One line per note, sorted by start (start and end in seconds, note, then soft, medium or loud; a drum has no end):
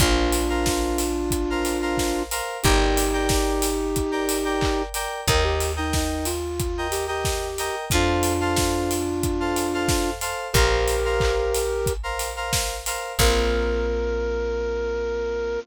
0.00 2.41 A#1 medium
0.00 2.23 D4 medium
0.00 2.23 F4 medium
0.00 0.39 A#4 loud
0.00 0.39 C5 loud
0.00 0.39 F5 loud
0.00 kick loud
0.00 closed hi-hat loud
0.32 open hi-hat medium
0.49 1.02 A#4 medium
0.49 1.02 C5 medium
0.49 1.02 F5 medium
0.66 kick medium
0.66 snare loud
0.98 open hi-hat medium
1.31 kick medium
1.31 closed hi-hat loud
1.50 1.77 A#4 medium
1.50 1.77 C5 medium
1.50 1.77 F5 medium
1.65 open hi-hat medium
1.82 2.21 A#4 medium
1.82 2.21 C5 medium
1.82 2.21 F5 medium
1.97 kick medium
1.97 snare loud
2.31 2.57 A#4 medium
2.31 2.57 C5 medium
2.31 2.57 F5 medium
2.31 open hi-hat medium
2.63 5.07 G1 medium
2.63 4.82 D#4 medium
2.63 4.82 G4 medium
2.63 3.03 A#4 loud
2.63 3.03 D5 loud
2.63 3.03 G5 loud
2.63 kick loud
2.63 closed hi-hat loud
2.97 open hi-hat loud
3.13 3.66 A#4 medium
3.13 3.66 D5 loud
3.13 3.66 G5 medium
3.29 kick loud
3.29 snare loud
3.62 open hi-hat loud
3.96 kick medium
3.96 closed hi-hat loud
4.11 4.38 A#4 medium
4.11 4.38 D5 medium
4.11 4.38 G5 medium
4.29 open hi-hat loud
4.45 4.84 A#4 medium
4.45 4.84 D5 medium
4.45 4.84 G5 medium
4.61 kick loud
4.61 clap loud
4.94 5.20 A#4 medium
4.94 5.20 D5 medium
4.94 5.20 G5 medium
4.94 open hi-hat medium
5.27 7.70 D#2 medium
5.27 5.67 A#4 loud
5.27 5.44 A#4 medium
5.27 5.67 D#5 loud
5.27 5.67 G5 medium
5.27 kick loud
5.27 closed hi-hat loud
5.44 5.72 G4 medium
5.60 open hi-hat medium
5.76 5.94 D#4 medium
5.76 6.29 A#4 medium
5.76 6.29 D#5 medium
5.76 6.29 G5 medium
5.93 6.26 D#4 medium
5.93 kick medium
5.93 snare loud
6.25 6.87 F4 medium
6.25 open hi-hat medium
6.60 kick loud
6.60 closed hi-hat loud
6.78 7.04 A#4 medium
6.78 7.04 D#5 medium
6.78 7.04 G5 medium
6.91 7.07 G4 medium
6.91 open hi-hat medium
7.07 7.75 G4 medium
7.07 7.47 A#4 medium
7.07 7.47 D#5 medium
7.07 7.47 G5 medium
7.25 kick medium
7.25 snare loud
7.58 7.85 A#4 loud
7.58 7.85 D#5 medium
7.58 7.85 G5 medium
7.58 open hi-hat medium
7.90 10.34 F2 medium
7.90 10.10 D4 medium
7.90 10.10 F4 medium
7.90 8.32 A4 loud
7.90 8.32 C5 loud
7.90 8.32 F5 loud
7.90 kick loud
7.90 closed hi-hat loud
8.23 open hi-hat medium
8.41 8.93 A4 medium
8.41 8.93 C5 loud
8.41 8.93 F5 medium
8.56 kick medium
8.56 snare loud
8.91 open hi-hat medium
9.23 kick medium
9.23 closed hi-hat loud
9.40 9.66 A4 medium
9.40 9.66 C5 medium
9.40 9.66 F5 medium
9.56 open hi-hat medium
9.74 10.13 A4 medium
9.74 10.13 C5 medium
9.74 10.13 F5 loud
9.88 kick loud
9.88 snare loud
10.21 10.47 A4 medium
10.21 10.47 C5 loud
10.21 10.47 F5 medium
10.21 open hi-hat medium
10.53 12.97 A#1 medium
10.53 11.93 G4 medium
10.53 11.93 A#4 medium
10.53 10.95 A#4 loud
10.53 10.95 C5 loud
10.53 10.95 F5 medium
10.53 kick loud
10.53 closed hi-hat loud
10.88 open hi-hat medium
11.05 11.58 A#4 medium
11.05 11.58 C5 medium
11.05 11.58 F5 medium
11.20 kick loud
11.20 clap loud
11.55 open hi-hat medium
11.86 kick loud
11.86 closed hi-hat loud
12.03 12.30 A#4 medium
12.03 12.30 C5 medium
12.03 12.30 F5 medium
12.19 open hi-hat medium
12.36 12.76 A#4 medium
12.36 12.76 C5 medium
12.36 12.76 F5 loud
12.53 kick medium
12.53 snare loud
12.86 13.12 A#4 medium
12.86 13.12 C5 medium
12.86 13.12 F5 medium
12.86 open hi-hat medium
13.18 15.58 A#1 loud
13.18 15.58 A#3 loud
13.18 15.58 C4 loud
13.18 15.58 F4 loud
13.18 15.60 A#4 loud
13.18 kick loud
13.18 crash loud